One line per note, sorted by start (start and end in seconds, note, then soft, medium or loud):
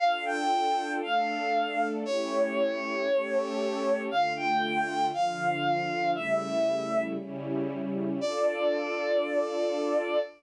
0.00 1.01 D4 medium
0.00 1.01 F4 medium
0.00 1.01 A4 medium
0.00 0.24 F5 loud
0.25 0.92 G5 medium
1.02 2.04 A3 medium
1.02 2.04 D4 medium
1.02 2.04 A4 medium
1.02 1.88 F5 medium
2.05 3.07 A3 medium
2.05 3.07 C#4 medium
2.05 3.07 E4 medium
2.05 3.07 G4 medium
2.05 4.02 C#5 loud
3.08 4.09 A3 medium
3.08 4.09 C#4 medium
3.08 4.09 G4 medium
3.08 4.09 A4 medium
4.10 5.11 D3 medium
4.10 5.11 A3 loud
4.10 5.11 F4 medium
4.10 4.33 F5 loud
4.36 5.06 G5 medium
5.13 6.14 D3 medium
5.13 6.14 F3 medium
5.13 6.14 F4 medium
5.13 6.11 F5 medium
6.14 7.16 C#3 medium
6.14 7.16 G3 medium
6.14 7.16 A3 medium
6.14 7.16 E4 medium
6.14 7.02 E5 medium
7.18 8.20 C#3 medium
7.18 8.20 G3 loud
7.18 8.20 C#4 loud
7.18 8.20 E4 medium
8.20 10.19 D4 medium
8.20 10.19 F4 loud
8.20 10.19 A4 loud
8.20 10.20 D5 loud